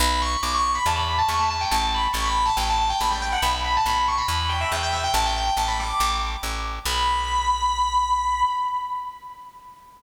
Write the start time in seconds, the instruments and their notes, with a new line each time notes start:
0.00 electric bass (finger) B1, distortion guitar B5
0.22 distortion guitar C#6
0.43 electric bass (finger) B1, distortion guitar D6
0.54 distortion guitar C#6
0.75 distortion guitar B5
0.86 electric bass (finger) E2, distortion guitar A5
0.95 distortion guitar B5
1.18 distortion guitar A5
1.28 electric bass (finger) E2, distortion guitar C#6
1.39 distortion guitar A5
1.50 distortion guitar A5
1.61 distortion guitar G5
1.71 electric bass (finger) A1, distortion guitar A5
1.94 distortion guitar B5
2.13 electric bass (finger) A1, distortion guitar C#6
2.25 distortion guitar B5
2.45 distortion guitar A5
2.57 electric bass (finger) A1, distortion guitar G5
2.69 distortion guitar A5
2.89 distortion guitar G5
3.01 electric bass (finger) A1, distortion guitar B5
3.11 distortion guitar G5
3.22 distortion guitar G5
3.32 distortion guitar F#5
3.42 electric bass (finger) B1, distortion guitar B5
3.64 distortion guitar B5
3.76 distortion guitar A5
3.86 electric bass (finger) B1, distortion guitar B5
4.08 distortion guitar C#6
4.18 distortion guitar B5
4.28 electric bass (finger) E2
4.49 distortion guitar G5
4.61 distortion guitar E5
4.72 electric bass (finger) E2, distortion guitar G5
4.82 distortion guitar G5
4.93 distortion guitar E5
5.04 distortion guitar G5
5.14 electric bass (finger) A1, distortion guitar A5
5.26 distortion guitar G5
5.36 distortion guitar G5
5.57 electric bass (finger) A1, distortion guitar A5
5.68 distortion guitar B5
5.80 distortion guitar D6
6.00 electric bass (finger) A1
6.43 electric bass (finger) A1
6.85 electric bass (finger) B1, distortion guitar B5